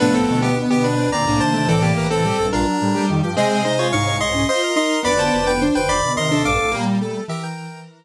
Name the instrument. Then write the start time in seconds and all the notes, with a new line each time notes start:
lead 1 (square)
0.00 C2 A2 F3 A3 B3 D4 B4
0.14 C4 A4
0.28 D2 B2
0.42 B3 G4
0.56 B3
0.70 B3 G4
0.84 D4 B4
0.96 C4
1.12 D2 A#2 C4 D5 A#5
1.26 C2 A2 A#3 D4
1.40 D#2 C3 C5 A5
1.54 D#2 C3 A3
1.68 C2 A2 E3 C4 A4 D5
1.82 A#3 G4
1.96 C2 A2 A#4
2.10 E3 C4 A4
2.24 G3 G4
2.38 A#1 G2 A4
2.52 A#1 G2 D4 F4 A#4
2.66 F#3
2.81 A2 G3
2.94 G3 G4
3.09 F2 D#3
3.23 G2 F3 G4
3.36 C3 G#3 C4 G#4 C5 D#5
3.64 C3 G#3 D#4 C5
3.79 F4 C#5
3.92 C2 G#2 D#4 C#5 F5 C#6
4.06 C#5
4.20 D#5 C6
4.34 C#4
4.48 F4 C5 D#5 C6
4.63 A#4
4.76 D#4 D#5 C6
5.03 F1 D2 B3 B4 D5 B5
5.19 C5 A5
5.33 F1 D2
5.46 B3 B4 G5
5.61 D4 C5
5.75 F1 D2 B4 C5 G5
5.89 F1 D2 D5 B5
6.03 D2 B2
6.17 D#2 C3 A#4 D#5 C6
6.31 D4 A4
6.45 A#1 G2 F5 D6
6.59 C2 A2
6.72 A#2 G3 A#3
6.86 G3
7.01 A3 A4
7.28 E3 G4 A#4 E5
7.43 A#4 G5